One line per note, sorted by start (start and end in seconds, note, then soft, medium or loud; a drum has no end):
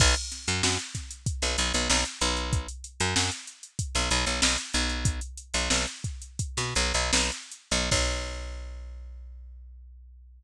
0.00 0.15 B1 loud
0.00 kick loud
0.00 crash loud
0.16 closed hi-hat medium
0.32 snare soft
0.32 closed hi-hat loud
0.47 0.62 F#2 loud
0.47 closed hi-hat medium
0.63 0.78 F#2 medium
0.63 snare loud
0.79 closed hi-hat medium
0.95 kick medium
0.95 snare soft
0.95 closed hi-hat loud
1.11 closed hi-hat medium
1.26 kick loud
1.26 closed hi-hat loud
1.42 1.57 B1 medium
1.42 snare medium
1.42 closed hi-hat medium
1.58 1.73 B1 loud
1.58 snare soft
1.58 closed hi-hat loud
1.74 1.88 B1 medium
1.74 snare soft
1.74 closed hi-hat medium
1.90 2.04 B1 loud
1.90 snare loud
2.05 closed hi-hat medium
2.21 2.67 B1 loud
2.21 closed hi-hat medium
2.37 closed hi-hat medium
2.53 kick loud
2.53 closed hi-hat loud
2.68 closed hi-hat medium
2.84 closed hi-hat medium
3.00 3.15 F#2 loud
3.00 closed hi-hat medium
3.16 3.30 F#2 medium
3.16 snare loud
3.32 closed hi-hat medium
3.47 closed hi-hat medium
3.63 closed hi-hat medium
3.79 kick loud
3.79 closed hi-hat loud
3.95 4.10 B1 medium
3.95 snare medium
3.95 closed hi-hat medium
4.11 4.25 B1 loud
4.11 closed hi-hat loud
4.26 4.41 B1 medium
4.26 closed hi-hat medium
4.42 4.57 B1 medium
4.42 snare loud
4.58 closed hi-hat medium
4.74 5.20 B1 loud
4.74 closed hi-hat medium
4.89 closed hi-hat medium
5.05 kick loud
5.05 closed hi-hat loud
5.21 closed hi-hat medium
5.37 closed hi-hat medium
5.54 5.69 B1 medium
5.54 closed hi-hat medium
5.70 5.86 B1 medium
5.70 snare loud
5.87 closed hi-hat medium
6.04 kick loud
6.04 closed hi-hat medium
6.22 closed hi-hat medium
6.39 kick loud
6.39 closed hi-hat loud
6.57 6.74 B2 medium
6.57 snare medium
6.57 closed hi-hat medium
6.75 6.93 B1 loud
6.75 snare soft
6.75 closed hi-hat medium
6.94 7.11 B1 medium
6.94 closed hi-hat medium
7.13 7.31 B1 medium
7.13 snare loud
7.32 closed hi-hat medium
7.51 closed hi-hat medium
7.71 7.90 B1 loud
7.71 closed hi-hat medium
7.91 10.43 B1 loud
7.91 kick loud
7.91 crash loud